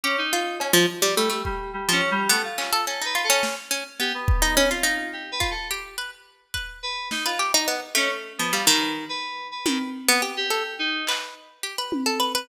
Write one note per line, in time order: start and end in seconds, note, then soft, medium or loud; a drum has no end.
0.04 0.16 C#4 loud
0.04 0.29 G4 medium
0.18 0.56 D#4 loud
0.33 0.58 F4 medium
0.60 0.74 C#4 medium
0.60 cowbell loud
0.73 0.86 F3 loud
1.02 1.15 G3 loud
1.17 1.42 G3 medium
1.17 1.29 A3 medium
1.30 1.42 A3 medium
1.45 1.71 G3 medium
1.45 kick medium
1.73 1.90 G3 medium
1.89 2.01 F3 medium
1.89 2.09 C#4 loud
2.11 2.28 G3 loud
2.29 2.43 A3 medium
2.29 2.42 B3 loud
2.29 closed hi-hat loud
2.44 2.82 F4 medium
2.58 2.71 C#4 medium
2.58 clap loud
2.73 2.85 A4 loud
2.87 3.00 C#4 medium
2.87 3.04 A4 medium
3.02 3.14 D#4 medium
3.02 3.22 B4 medium
3.15 3.28 F4 medium
3.24 3.41 A4 medium
3.30 3.55 C#4 loud
3.43 snare medium
3.71 3.84 C#4 medium
4.00 4.12 B3 medium
4.00 4.13 G4 medium
4.14 4.65 B3 medium
4.28 kick loud
4.42 4.55 D#4 loud
4.56 4.70 C#4 loud
4.56 high tom medium
4.70 5.09 F4 medium
4.70 4.84 F4 medium
4.83 5.34 D#4 medium
4.83 closed hi-hat medium
5.13 5.30 G4 medium
5.32 5.49 B4 medium
5.40 5.53 F4 medium
5.40 kick medium
5.51 5.68 A4 medium
5.71 5.96 G4 medium
5.98 6.11 B4 medium
6.54 6.79 B4 medium
6.54 kick medium
6.83 7.08 B4 medium
7.11 7.24 D#4 medium
7.11 snare medium
7.25 7.38 F4 medium
7.25 7.38 B4 medium
7.39 7.52 G4 medium
7.54 7.67 D#4 loud
7.68 7.80 B3 medium
7.95 8.33 A3 loud
7.95 8.09 C#4 loud
7.95 clap medium
8.38 8.52 F3 medium
8.38 8.51 B3 medium
8.52 8.66 G3 medium
8.52 8.65 F4 medium
8.67 9.05 D#3 loud
8.67 8.92 B4 medium
8.81 cowbell medium
9.09 9.47 B4 medium
9.51 9.90 B4 medium
9.66 9.78 D#3 medium
9.66 high tom loud
10.08 10.21 B3 loud
10.22 10.35 G4 medium
10.37 10.75 G4 loud
10.50 10.63 A4 medium
10.79 11.04 D#4 loud
11.07 11.34 B4 medium
11.07 clap loud
11.63 11.76 G4 medium
11.78 12.04 B4 medium
11.92 high tom loud
12.06 12.19 A4 medium
12.20 12.32 B4 medium
12.35 12.48 B4 loud